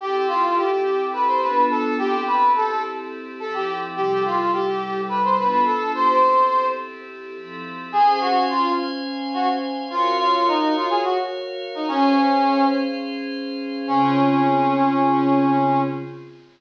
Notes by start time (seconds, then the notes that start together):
0.00 C4 E4 G4 A4
0.28 F4
0.56 G4
1.13 B4
1.27 C5
1.41 B3 D4 F4 A4 B4
1.70 A4
1.98 C4 E4 G4 A4
2.27 B4
2.56 A4
3.40 F3 C4 E4 A4
3.54 G4
3.96 C3 G3 E4 G4 A4
4.25 F4
4.53 G4
5.09 B4
5.24 C5
5.38 B3 D4 F4 A4 B4
5.65 A4
5.94 C4 E4 G4 A4 C5
7.36 F3 C4 E4 A4
7.92 C#4 G#4 C5 F5 G#5
8.20 F#4
8.49 F4
9.34 F#4
9.90 F4 F#4 A#4 C#5 F5
10.19 F4
10.47 D#4
10.76 F4
10.90 G#4
11.04 F#4
11.75 D#4
11.88 C#4 G#4 C5 F5
13.87 C#3 C4 C#4 F4 G#4